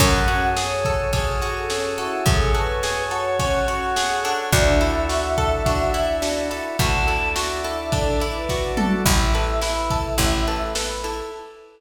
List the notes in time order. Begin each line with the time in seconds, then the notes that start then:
0.00 F#2 C#4 F#4 G#4 A4 F#5, kick, crash
0.28 F#4, ride
0.56 G#4 C#5, snare
0.85 A4, kick, ride
1.12 C#4 G#4, kick, ride
1.42 F#4, ride
1.56 A4
1.70 C#4 G#4, snare
1.98 E4 F#4 A4, ride
2.26 F#2 C#4 F#4 G#4 A4 C#5, kick, ride
2.54 F#4 A4 B4, ride
2.83 G#4, snare
3.11 F#4 A4 C#5, ride
3.39 C#4 F#5, kick, ride
3.68 F#4 F#5, ride
3.96 G#4, snare
4.24 D4 A4, ride
4.52 D2 D4 E4 F#4 A4 E5, kick, ride
4.81 E4, ride
5.09 F#4, snare
5.38 A4, kick, ride
5.66 D4 F#4, kick, ride
5.94 E4, ride
6.22 D4 F#4, snare
6.50 E4 A4, ride
6.79 D2 D4 E4 F#4 A4 D5 A5, kick, ride
7.07 E4 A4, ride
7.36 F#4 E5, snare
7.64 E4 A4, ride
7.92 D4 A4, kick, ride
8.20 E4, ride
8.35 B4
8.49 F#4, kick, snare
8.77 F#4 A4, mid tom
9.05 A1 E4, kick, crash
9.34 A4 B4, ride
9.62 E4 B4, snare
9.90 A4, kick, ride
10.18 A1 E4, kick, ride
10.47 A4 B4, ride
10.75 A4 B4, snare
11.04 E4 A4, ride